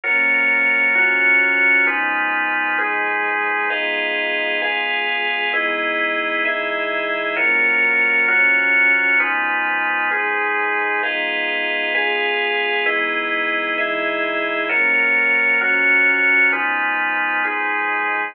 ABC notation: X:1
M:4/4
L:1/8
Q:1/4=131
K:G#m
V:1 name="Pad 2 (warm)"
[F,,^E,A,C]4 [F,,E,F,C]4 | [G,,^E,B,D]4 [G,,E,G,D]4 | [G,B,D^E]4 [G,B,EG]4 | [E,G,B,D]4 [E,G,DE]4 |
[F,,^E,A,C]4 [F,,E,F,C]4 | [G,,^E,B,D]4 [G,,E,G,D]4 | [G,B,D^E]4 [G,B,EG]4 | [E,G,B,D]4 [E,G,DE]4 |
[F,,^E,A,C]4 [F,,E,F,C]4 | [G,,^E,B,D]4 [G,,E,G,D]4 |]
V:2 name="Drawbar Organ"
[F,^EAc]4 [F,EFc]4 | [G,D^EB]4 [G,DGB]4 | [GBd^e]4 [GBeg]4 | [EGBd]4 [EGde]4 |
[F,^EAc]4 [F,EFc]4 | [G,D^EB]4 [G,DGB]4 | [GBd^e]4 [GBeg]4 | [EGBd]4 [EGde]4 |
[F,^EAc]4 [F,EFc]4 | [G,D^EB]4 [G,DGB]4 |]